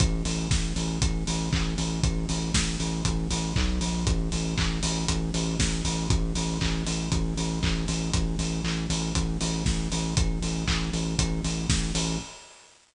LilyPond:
<<
  \new Staff \with { instrumentName = "Synth Bass 2" } { \clef bass \time 4/4 \key a \phrygian \tempo 4 = 118 a,,8 a,,8 a,,8 a,,8 a,,8 a,,8 a,,8 a,,8 | a,,8 a,,8 a,,8 a,,8 a,,8 a,,8 b,,8 bes,,8 | a,,8 a,,8 a,,8 a,,8 a,,8 a,,8 a,,8 a,,8 | a,,8 a,,8 a,,8 a,,8 a,,8 a,,8 a,,8 a,,8 |
a,,8 a,,8 a,,8 a,,8 a,,8 a,,8 a,,8 a,,8 | a,,8 a,,8 a,,8 a,,8 a,,8 a,,8 a,,8 a,,8 | }
  \new DrumStaff \with { instrumentName = "Drums" } \drummode { \time 4/4 <hh bd>8 hho8 <bd sn>8 hho8 <hh bd>8 hho8 <hc bd>8 hho8 | <hh bd>8 hho8 <bd sn>8 hho8 <hh bd>8 hho8 <hc bd>8 hho8 | <hh bd>8 hho8 <hc bd>8 hho8 <hh bd>8 hho8 <bd sn>8 hho8 | <hh bd>8 hho8 <hc bd>8 hho8 <hh bd>8 hho8 <hc bd>8 hho8 |
<hh bd>8 hho8 hc8 hho8 <hh bd>8 hho8 <bd sn>8 hho8 | <hh bd>8 hho8 <hc bd>8 hho8 <hh bd>8 hho8 <bd sn>8 hho8 | }
>>